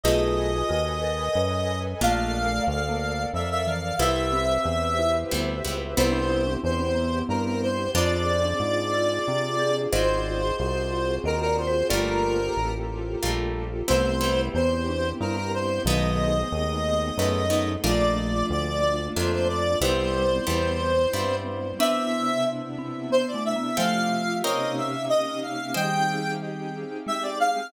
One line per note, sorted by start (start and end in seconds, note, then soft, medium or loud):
0.04 0.63 B1 medium
0.04 0.51 A3 loud
0.04 0.51 B3 medium
0.04 0.51 D#4 loud
0.04 0.67 F4 loud
0.04 0.67 G#4 loud
0.04 0.51 G#4 medium
0.04 2.00 A4 medium
0.04 2.00 B4 medium
0.04 1.79 D#5 medium
0.04 2.00 D#5 medium
0.04 2.00 G#5 medium
0.69 1.29 D#2 medium
0.69 0.97 F#4 medium
1.04 1.36 A#4 medium
1.35 1.95 F#2 medium
1.35 1.53 B4 medium
2.01 2.61 A#1 medium
2.01 2.47 A3 loud
2.01 2.47 A#3 loud
2.01 2.43 A#3 loud
2.01 2.47 D4 medium
2.01 2.47 F4 loud
2.01 3.98 A4 medium
2.01 3.98 A#4 medium
2.01 3.98 D5 medium
2.01 3.98 F5 medium
2.01 2.63 F5 medium
2.45 2.80 A3 medium
2.67 3.26 D2 medium
2.67 3.23 F5 medium
2.89 3.31 A#3 medium
3.34 3.93 F2 medium
3.34 3.64 F3 medium
3.34 3.49 E5 medium
3.51 3.66 E5 medium
3.67 3.97 E3 medium
3.67 3.95 F5 medium
3.99 4.58 C2 medium
3.99 4.45 G3 loud
3.99 4.45 B3 medium
3.99 4.45 C4 medium
3.99 4.45 E4 medium
3.99 4.32 E4 loud
3.99 5.95 G4 medium
3.99 5.95 B4 medium
3.99 5.95 C5 medium
3.99 5.95 E5 medium
3.99 5.15 E5 medium
4.33 4.92 C4 medium
4.65 5.24 E2 medium
4.99 5.31 E4 medium
5.31 5.62 D2 medium
5.31 5.55 G3 medium
5.31 5.55 B3 medium
5.31 5.55 C4 medium
5.31 5.55 E4 medium
5.65 5.95 C#2 medium
5.65 5.88 G3 medium
5.65 5.88 B3 medium
5.65 5.88 C4 medium
5.65 5.88 E4 medium
5.97 6.57 C2 medium
5.97 6.43 G3 loud
5.97 6.43 B3 loud
5.97 7.93 B3 medium
5.97 6.13 B3 loud
5.97 6.43 C4 loud
5.97 7.93 C4 medium
5.97 6.43 E4 loud
5.97 7.93 E4 medium
5.97 7.93 G4 medium
5.97 6.54 C5 medium
6.12 6.28 D4 loud
6.29 6.44 E4 medium
6.47 6.75 D4 medium
6.64 7.23 E2 medium
6.64 7.19 C5 medium
6.80 6.96 C4 medium
6.95 7.79 B3 medium
7.29 7.88 G2 medium
7.29 7.44 A#4 medium
7.45 7.61 A#4 medium
7.63 7.91 C5 medium
7.95 8.54 F2 loud
7.95 8.41 G#3 loud
7.95 8.41 C4 loud
7.95 8.38 C4 loud
7.95 9.91 C4 medium
7.95 8.41 D4 loud
7.95 9.91 D4 medium
7.95 8.41 F4 loud
7.95 9.91 F4 medium
7.95 9.91 G#4 medium
7.95 9.76 D5 medium
8.45 8.85 D4 medium
8.60 9.19 G#2 medium
8.94 9.26 F4 medium
9.28 9.87 C3 medium
9.59 9.91 G#4 medium
9.92 10.52 G#1 medium
9.92 10.39 G#3 loud
9.92 11.88 C4 medium
9.92 10.39 C4 medium
9.92 11.88 F4 medium
9.92 10.39 F4 medium
9.92 11.88 F#4 medium
9.92 10.39 F#4 medium
9.92 11.88 G#4 medium
9.92 11.16 C5 loud
9.92 10.56 C5 medium
9.92 11.16 D#5 loud
10.58 11.19 C2 medium
10.58 11.15 C5 medium
11.24 11.83 D#2 medium
11.24 11.40 A#4 medium
11.24 11.46 D#5 medium
11.41 11.56 A#4 medium
11.46 11.67 D5 medium
11.58 11.88 C5 medium
11.67 11.88 C5 loud
11.90 12.50 G1 medium
11.90 12.37 G3 loud
11.90 12.37 A3 medium
11.90 12.37 A#3 medium
11.90 13.86 A#3 medium
11.90 12.37 F4 loud
11.90 13.86 F4 medium
11.90 13.86 G4 loud
11.90 13.86 A4 medium
11.90 12.46 A#4 medium
11.90 12.72 A#4 medium
11.90 12.46 D5 loud
12.57 13.16 A1 medium
13.23 13.83 A#1 medium
13.23 13.69 G3 medium
13.23 13.69 A3 medium
13.23 13.69 A#3 medium
13.23 13.69 F4 medium
13.88 14.49 C2 loud
13.88 14.11 G3 medium
13.88 14.46 A3 medium
13.88 14.11 B3 medium
13.88 15.84 B3 medium
13.88 14.11 C4 loud
13.88 15.84 C4 medium
13.88 14.46 C4 loud
13.88 14.11 E4 loud
13.88 15.84 E4 medium
13.88 15.84 G4 medium
13.88 14.41 C5 medium
14.21 14.67 G3 medium
14.21 14.67 B3 medium
14.21 14.67 C4 medium
14.21 14.67 E4 medium
14.54 15.13 E2 medium
14.54 14.85 B3 loud
14.54 15.09 C5 medium
14.89 15.18 D4 medium
15.20 15.80 G2 medium
15.20 15.36 E4 medium
15.20 15.36 A#4 medium
15.36 15.52 A#4 medium
15.54 15.83 C5 medium
15.85 16.44 B1 medium
15.85 16.40 D#3 medium
15.85 16.40 F#3 loud
15.85 16.33 G#3 loud
15.85 17.82 A3 medium
15.85 16.33 A3 medium
15.85 17.82 B3 loud
15.85 16.33 B3 medium
15.85 17.82 D#4 medium
15.85 16.33 D#4 medium
15.85 17.82 G#4 medium
15.85 17.69 D#5 medium
16.52 17.12 D#2 medium
17.18 17.77 F#2 medium
17.18 17.42 G#3 medium
17.18 17.42 A3 medium
17.18 17.42 B3 medium
17.18 17.42 D#4 medium
17.50 17.73 G#3 medium
17.50 17.73 A3 medium
17.50 17.73 B3 medium
17.50 17.73 D#4 medium
17.84 18.43 A#1 medium
17.84 18.99 F3 medium
17.84 18.30 A3 medium
17.84 18.99 A3 loud
17.84 19.81 A3 medium
17.84 18.30 A#3 loud
17.84 19.81 A#3 medium
17.84 18.30 D4 loud
17.84 19.81 D4 medium
17.84 18.30 F4 loud
17.84 19.81 F4 medium
17.84 18.46 D5 medium
18.50 19.09 D2 medium
18.50 19.05 D5 medium
19.16 19.76 F2 medium
19.16 19.63 A3 medium
19.16 19.63 A#3 medium
19.16 19.63 D4 medium
19.16 19.63 F4 medium
19.16 19.73 A4 medium
19.16 19.32 C5 medium
19.32 19.48 C5 medium
19.49 19.79 D5 medium
19.81 20.40 C2 medium
19.81 20.28 G3 loud
19.81 21.77 G3 medium
19.81 20.28 B3 loud
19.81 21.77 B3 medium
19.81 20.28 C4 loud
19.81 21.77 C4 medium
19.81 20.28 E4 loud
19.81 21.77 E4 medium
19.81 20.38 E4 medium
19.81 20.38 G4 medium
19.81 21.36 C5 medium
20.47 21.07 E2 medium
20.47 20.93 G3 medium
20.47 20.93 B3 medium
20.47 20.93 C4 medium
20.47 20.93 E4 medium
21.13 21.73 G2 medium
21.13 21.60 G3 medium
21.13 21.60 B3 medium
21.13 21.60 C4 medium
21.13 21.60 E4 medium
21.79 23.76 C3 medium
21.79 22.65 B3 medium
21.79 23.76 B3 medium
21.79 22.26 C4 loud
21.79 22.65 D4 loud
21.79 23.76 D4 loud
21.79 23.76 E4 medium
21.79 22.26 B4 loud
21.79 22.26 D5 loud
21.79 22.44 E5 medium
21.79 22.26 E5 medium
22.79 23.09 C4 medium
23.10 23.31 B3 medium
23.10 23.27 C5 medium
23.28 23.43 D5 medium
23.34 23.55 A3 medium
23.45 23.77 E5 medium
23.56 23.77 B3 medium
23.77 24.43 C3 medium
23.77 24.42 F3 loud
23.77 24.43 A3 medium
23.77 24.42 A3 loud
23.77 24.23 C4 loud
23.77 24.43 F4 medium
23.77 24.43 G4 medium
23.77 24.23 A4 loud
23.77 24.23 F5 loud
23.77 24.35 F5 medium
23.77 24.23 G5 loud
24.43 25.74 C3 medium
24.43 25.74 A#3 loud
24.43 24.90 C4 loud
24.43 25.74 C#4 medium
24.43 25.74 D#4 medium
24.43 25.74 G4 medium
24.43 24.90 A#4 loud
24.43 24.90 C#5 loud
24.43 24.75 D#5 medium
24.43 24.90 D#5 loud
24.43 24.90 G5 medium
24.77 25.05 E5 medium
25.09 25.40 D#5 medium
25.42 25.73 F5 medium
25.74 26.85 D#3 medium
25.74 26.85 G3 medium
25.74 27.71 C4 medium
25.74 27.71 D#4 medium
25.74 27.71 G4 medium
25.74 27.71 G#4 medium
25.74 26.21 C5 medium
25.74 26.21 D#5 loud
25.74 26.21 G5 medium
25.74 26.31 G5 medium
25.74 26.21 G#5 medium
27.07 27.55 G#3 medium
27.07 27.23 E5 medium
27.23 27.39 D5 medium
27.40 27.68 F5 medium